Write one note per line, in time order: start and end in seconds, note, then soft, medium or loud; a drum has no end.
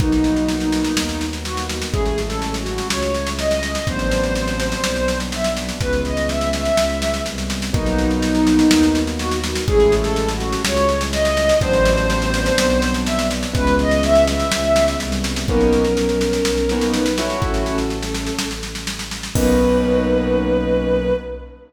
0.00 0.87 B1 medium
0.00 1.91 A#3 medium
0.00 1.91 B3 medium
0.00 1.25 D#4 loud
0.00 1.91 D#4 medium
0.00 1.91 F#4 medium
0.00 kick loud
0.00 snare medium
0.12 snare medium
0.24 snare medium
0.36 snare medium
0.48 snare medium
0.60 snare medium
0.72 snare medium
0.84 snare medium
0.96 1.83 D#2 medium
0.96 snare loud
1.09 snare medium
1.21 snare medium
1.33 snare medium
1.45 1.65 F#4 medium
1.45 snare medium
1.57 snare medium
1.69 snare medium
1.82 snare medium
1.92 2.80 A1 medium
1.92 3.82 G#3 medium
1.92 3.82 A3 medium
1.92 3.82 C#4 medium
1.92 3.82 E4 medium
1.92 2.19 G#4 loud
1.92 kick loud
1.92 snare medium
2.06 snare medium
2.18 snare medium
2.26 2.54 A4 medium
2.30 snare medium
2.42 snare medium
2.54 snare medium
2.59 2.88 F#4 medium
2.66 snare medium
2.78 snare medium
2.90 3.77 C#2 medium
2.90 3.29 C#5 medium
2.90 snare loud
3.02 snare medium
3.14 snare medium
3.27 snare medium
3.39 3.85 D#5 medium
3.39 snare medium
3.51 snare medium
3.63 snare medium
3.75 snare medium
3.86 4.73 A1 loud
3.86 5.77 F#3 medium
3.86 5.77 B3 medium
3.86 5.77 C4 medium
3.86 5.77 D4 medium
3.86 5.18 C5 loud
3.86 kick medium
3.86 snare medium
3.99 snare medium
4.11 snare medium
4.23 snare medium
4.35 snare medium
4.47 snare medium
4.60 snare medium
4.72 snare medium
4.84 5.72 B1 medium
4.84 snare loud
4.96 snare medium
5.08 snare medium
5.20 snare medium
5.32 5.53 E5 medium
5.32 snare medium
5.44 snare medium
5.57 snare medium
5.69 snare medium
5.81 6.69 C#2 medium
5.81 7.71 E3 medium
5.81 7.71 G#3 medium
5.81 7.71 B3 medium
5.81 7.71 C#4 medium
5.81 6.01 B4 loud
5.81 kick medium
5.81 snare medium
5.93 snare medium
6.05 6.28 D#5 medium
6.05 snare medium
6.17 snare medium
6.29 6.49 E5 medium
6.29 snare medium
6.41 snare medium
6.53 7.22 E5 medium
6.53 snare medium
6.65 snare medium
6.77 7.20 C#2 medium
6.77 snare loud
6.90 snare medium
7.02 snare medium
7.14 snare medium
7.26 7.70 C2 medium
7.26 snare medium
7.38 snare medium
7.50 snare medium
7.62 snare medium
7.73 8.63 B1 loud
7.73 9.63 A#3 medium
7.73 9.63 B3 medium
7.73 9.63 D#4 medium
7.73 9.00 D#4 loud
7.73 9.63 F#4 medium
7.73 kick loud
7.73 snare medium
7.86 snare medium
7.98 snare medium
8.10 snare medium
8.22 snare medium
8.35 snare medium
8.47 snare medium
8.59 snare medium
8.70 9.57 D#2 medium
8.70 snare loud
8.83 snare medium
8.95 snare medium
9.07 snare medium
9.19 9.39 F#4 loud
9.19 snare medium
9.31 snare medium
9.44 snare medium
9.55 snare medium
9.68 10.55 A1 loud
9.68 11.57 G#3 medium
9.68 11.57 A3 medium
9.68 11.57 C#4 medium
9.68 11.57 E4 medium
9.68 9.94 G#4 loud
9.68 kick loud
9.68 snare medium
9.80 snare medium
9.92 snare loud
10.00 10.28 A4 loud
10.04 snare medium
10.16 snare medium
10.28 10.61 F#4 medium
10.28 snare medium
10.40 snare medium
10.53 snare medium
10.64 11.52 C#2 medium
10.64 11.03 C#5 loud
10.64 snare loud
10.77 snare medium
10.89 snare medium
11.01 snare medium
11.12 11.59 D#5 loud
11.12 snare loud
11.25 snare medium
11.37 snare medium
11.49 snare medium
11.61 12.49 A1 loud
11.61 13.51 F#3 medium
11.61 13.51 B3 medium
11.61 13.51 C4 medium
11.61 13.51 D4 medium
11.61 12.93 C5 loud
11.61 kick loud
11.61 snare medium
11.73 snare medium
11.85 snare loud
11.97 snare medium
12.10 snare medium
12.22 snare medium
12.34 snare medium
12.46 snare medium
12.58 13.46 B1 loud
12.58 snare loud
12.70 snare medium
12.82 snare loud
12.94 snare medium
13.06 13.26 E5 loud
13.06 snare loud
13.19 snare medium
13.31 snare medium
13.43 snare medium
13.53 14.43 C#2 loud
13.53 15.43 E3 medium
13.53 15.43 G#3 medium
13.53 15.43 B3 medium
13.53 15.43 C#4 medium
13.53 13.75 B4 loud
13.53 kick loud
13.53 snare loud
13.67 snare medium
13.79 14.03 D#5 loud
13.79 snare medium
13.91 snare medium
14.03 14.23 E5 loud
14.03 snare medium
14.15 snare medium
14.28 14.98 E5 loud
14.28 snare medium
14.40 snare medium
14.51 14.95 C#2 medium
14.51 snare loud
14.64 snare medium
14.76 snare loud
14.88 snare medium
15.00 15.44 C2 medium
15.00 snare medium
15.12 snare medium
15.24 snare medium
15.36 snare medium
15.48 16.38 B1 loud
15.48 15.83 A#3 medium
15.48 15.83 B3 loud
15.48 16.84 C#4 medium
15.48 15.83 C#4 loud
15.48 15.83 D#4 medium
15.48 16.84 A#4 medium
15.48 kick loud
15.48 snare medium
15.61 snare medium
15.73 snare medium
15.84 snare medium
15.97 snare medium
16.09 snare medium
16.21 snare medium
16.33 snare medium
16.44 17.33 B1 medium
16.44 snare loud
16.57 snare medium
16.69 17.05 A#3 medium
16.69 17.05 B3 medium
16.69 17.05 C#4 medium
16.69 17.05 D#4 medium
16.69 snare medium
16.81 snare medium
16.94 17.13 D#4 medium
16.94 17.13 B4 medium
16.94 snare medium
17.06 snare medium
17.18 17.76 A3 medium
17.18 17.76 C#4 medium
17.18 17.39 E4 medium
17.18 17.76 E4 loud
17.18 17.76 F#4 loud
17.18 17.39 C#5 medium
17.18 snare medium
17.30 snare medium
17.41 18.30 A1 medium
17.41 17.63 C#4 medium
17.41 17.63 A4 medium
17.41 kick loud
17.41 snare medium
17.54 snare medium
17.66 18.46 C#4 medium
17.66 18.46 A4 medium
17.66 snare medium
17.78 snare medium
17.90 snare medium
18.03 snare medium
18.15 snare medium
18.27 snare medium
18.39 19.28 A1 medium
18.39 snare loud
18.51 snare medium
18.63 snare medium
18.75 snare medium
18.87 snare medium
18.99 snare medium
19.11 snare medium
19.23 snare medium
19.35 21.11 B1 loud
19.35 21.12 A#3 medium
19.35 21.12 B3 medium
19.35 21.12 C#4 medium
19.35 21.12 D#4 loud
19.35 21.13 B4 loud
19.35 kick loud
19.35 crash loud